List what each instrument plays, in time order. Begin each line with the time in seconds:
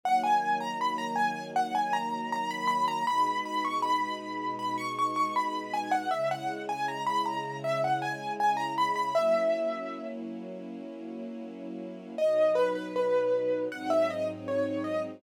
0.03 string ensemble 1 D#3 F#3 A#3, acoustic grand piano F#5
0.24 acoustic grand piano G#5
0.60 acoustic grand piano A#5
0.81 acoustic grand piano B5
0.98 acoustic grand piano A#5
1.16 acoustic grand piano G#5
1.56 acoustic grand piano F#5
1.75 acoustic grand piano G#5
1.93 acoustic grand piano A#5
2.32 acoustic grand piano A#5
2.51 acoustic grand piano B5
2.68 acoustic grand piano B5
2.88 acoustic grand piano A#5
3.07 string ensemble 1 B2 G#3 D#4, acoustic grand piano B5
3.46 acoustic grand piano B5
3.65 acoustic grand piano C#6
3.82 acoustic grand piano B5
4.59 acoustic grand piano B5
4.78 acoustic grand piano C#6
4.99 acoustic grand piano C#6
5.16 acoustic grand piano C#6
5.36 acoustic grand piano B5
5.74 acoustic grand piano G#5
5.91 acoustic grand piano F#5
6.11 string ensemble 1 C#3 G#3 E4, acoustic grand piano E5
6.31 acoustic grand piano F#5
6.69 acoustic grand piano G#5
6.88 acoustic grand piano A#5
7.06 acoustic grand piano B5
7.26 acoustic grand piano A#5
7.64 acoustic grand piano E5
7.84 acoustic grand piano F#5
8.02 acoustic grand piano G#5
8.40 acoustic grand piano G#5
8.57 acoustic grand piano A#5
8.78 acoustic grand piano B5
8.96 acoustic grand piano B5
9.15 string ensemble 1 F#3 A#3 C#4 E4, acoustic grand piano E5
12.18 string ensemble 1 B2 F#3 D#4, acoustic grand piano D#5
12.55 acoustic grand piano B4
12.75 acoustic grand piano B4
12.96 acoustic grand piano B4
13.71 string ensemble 1 G#2 F#3 C4 D#4, acoustic grand piano F#5
13.90 acoustic grand piano E5
14.10 acoustic grand piano D#5
14.48 acoustic grand piano C#5
14.84 acoustic grand piano D#5